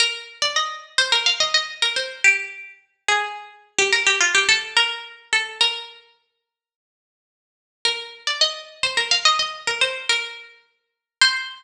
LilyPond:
\new Staff { \time 4/4 \key c \minor \tempo 4 = 107 bes'8 r16 d''16 ees''8. c''16 bes'16 f''16 ees''16 ees''16 r16 bes'16 c''8 | g'8. r8. aes'4~ aes'16 g'16 bes'16 g'16 f'16 g'16 | \time 2/4 a'8 bes'4 a'8 | \time 4/4 bes'4. r2 r8 |
bes'8 r16 d''16 ees''8. c''16 bes'16 f''16 ees''16 ees''16 r16 bes'16 c''8 | \time 2/4 bes'4 r4 | \time 4/4 c''1 | }